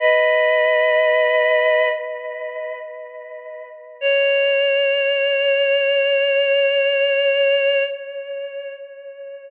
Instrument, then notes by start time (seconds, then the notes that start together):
choir aahs
0.00 B4 D#5
4.01 C#5